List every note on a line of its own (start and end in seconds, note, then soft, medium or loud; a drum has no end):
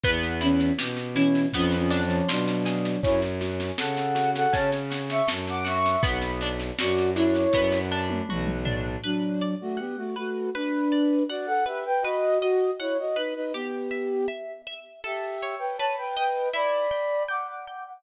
0.03 0.71 E2 loud
0.03 1.47 B3 medium
0.03 kick loud
0.03 snare medium
0.23 snare medium
0.41 0.72 E3 medium
0.41 0.72 C#4 loud
0.41 1.15 E4 medium
0.41 snare medium
0.60 snare medium
0.78 1.46 B2 medium
0.78 1.50 G4 medium
0.78 snare loud
0.97 snare medium
1.14 1.47 E3 medium
1.14 1.47 C#4 loud
1.14 1.52 E4 medium
1.14 snare medium
1.35 snare medium
1.53 2.21 F2 loud
1.53 1.78 F3 medium
1.53 2.97 B3 medium
1.53 1.78 C#4 loud
1.53 kick medium
1.53 snare medium
1.72 snare medium
1.78 2.02 F3 loud
1.78 2.02 C#4 loud
1.90 2.97 D4 medium
1.90 snare medium
2.04 2.28 F3 loud
2.04 2.28 C#4 loud
2.10 snare medium
2.28 2.96 B2 medium
2.28 3.00 F#3 medium
2.28 3.00 D4 medium
2.28 3.00 F4 medium
2.28 snare loud
2.48 snare medium
2.65 3.01 G#4 medium
2.65 snare medium
2.85 snare medium
3.03 3.71 F#2 loud
3.03 4.52 C#4 medium
3.03 3.20 E4 loud
3.03 3.20 C#5 loud
3.03 kick loud
3.03 snare medium
3.22 snare medium
3.41 4.14 F#4 medium
3.41 snare medium
3.60 snare medium
3.78 4.46 C#3 medium
3.78 5.27 A4 medium
3.78 4.30 A4 medium
3.78 4.30 F#5 loud
3.78 snare loud
3.97 snare medium
4.15 4.90 F#4 medium
4.15 snare medium
4.35 4.54 A4 medium
4.35 4.54 F#5 loud
4.35 snare medium
4.52 5.21 C#3 medium
4.52 5.95 C#4 medium
4.52 4.70 C#5 loud
4.52 4.70 A5 loud
4.52 kick loud
4.52 snare medium
4.72 snare medium
4.90 5.64 F#4 medium
4.90 snare loud
5.10 5.28 E5 medium
5.10 5.28 C#6 loud
5.10 snare medium
5.28 5.96 F#2 medium
5.28 5.99 A4 medium
5.28 snare loud
5.47 5.67 F#5 medium
5.47 5.67 D6 loud
5.47 snare medium
5.64 6.00 F#4 medium
5.64 6.02 E5 medium
5.64 6.02 C#6 loud
5.64 snare medium
5.86 snare medium
6.03 6.71 B1 medium
6.03 7.54 B3 medium
6.03 kick loud
6.03 snare loud
6.22 snare medium
6.41 7.15 D4 medium
6.41 snare medium
6.60 snare medium
6.79 7.46 F#2 medium
6.79 7.10 F#4 medium
6.79 8.29 F#4 medium
6.79 7.10 D5 medium
6.79 snare loud
6.98 snare medium
7.15 7.91 D4 medium
7.15 7.79 E4 medium
7.15 7.79 C#5 loud
7.15 snare medium
7.35 snare medium
7.53 8.21 F#2 loud
7.53 8.97 B3 medium
7.53 kick loud
7.53 snare loud
7.72 snare medium
7.91 8.65 D4 medium
8.10 high tom medium
8.29 8.96 B1 medium
8.29 9.01 F#4 medium
8.29 mid tom loud
8.47 mid tom loud
8.65 9.01 D4 medium
8.65 floor tom loud
9.04 9.55 F#3 loud
9.04 9.55 D4 loud
9.04 9.37 B4 medium
9.41 9.75 D5 medium
9.61 9.79 A3 medium
9.61 9.79 F#4 loud
9.77 9.96 B3 medium
9.77 9.96 G4 medium
9.77 10.11 F#5 soft
9.97 10.15 A3 medium
9.97 10.15 F#4 medium
10.16 10.50 A3 medium
10.16 10.50 F#4 medium
10.16 10.50 B4 medium
10.54 11.23 D4 medium
10.54 11.23 B4 medium
10.54 10.89 B4 medium
10.92 11.26 D5 medium
11.29 11.47 F#4 medium
11.29 11.47 D5 medium
11.29 11.63 F#5 medium
11.46 11.64 A4 medium
11.46 11.64 F#5 medium
11.66 11.84 G4 medium
11.66 12.00 B4 medium
11.66 11.84 E5 medium
11.85 12.03 B4 medium
11.85 12.03 G5 medium
12.02 12.38 F#4 medium
12.02 12.38 B4 medium
12.02 12.38 D#5 loud
12.40 12.70 F#4 medium
12.40 12.70 D#5 medium
12.40 12.76 D#5 medium
12.79 12.97 E4 medium
12.79 12.97 C#5 medium
12.79 13.13 F#5 medium
12.99 13.17 F#4 medium
12.99 13.17 D#5 medium
13.16 13.34 D#4 medium
13.16 13.34 B4 medium
13.16 13.50 B4 medium
13.35 13.52 D#4 medium
13.35 13.52 B4 medium
13.53 14.26 B3 medium
13.53 14.26 G4 medium
13.53 13.88 G4 medium
13.91 14.25 E5 medium
14.28 14.62 E5 medium
14.67 15.00 E5 medium
15.04 15.55 G4 medium
15.04 15.38 A4 medium
15.04 15.55 E5 medium
15.42 15.76 C#5 medium
15.59 15.77 B4 medium
15.59 15.77 G5 medium
15.78 16.13 B4 medium
15.78 15.96 C#5 medium
15.78 15.96 A5 medium
15.98 16.15 B4 medium
15.98 16.15 G5 medium
16.16 16.48 B4 medium
16.16 16.50 D#5 medium
16.16 16.48 G5 medium
16.53 16.87 E4 medium
16.53 17.23 D5 medium
16.53 17.23 B5 medium
16.91 17.25 G5 medium
17.28 17.47 F#5 medium
17.28 17.62 G5 medium
17.28 17.47 D6 medium
17.49 17.65 F#5 medium
17.49 17.65 D6 medium
17.66 17.83 F#5 medium
17.66 18.01 G5 medium
17.66 17.83 D6 medium
17.86 18.03 F#5 medium
17.86 18.03 D6 medium